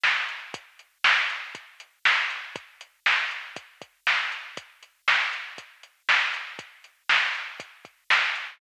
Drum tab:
HH |-x|xx-xxx-x|xx-xxx-x|xx-xxx-x|
SD |o-|--o---o-|--o---o-|--o---o-|
BD |--|o---o---|o---oo--|o---o---|

HH |xx-xxx-x|
SD |--o---o-|
BD |o---oo--|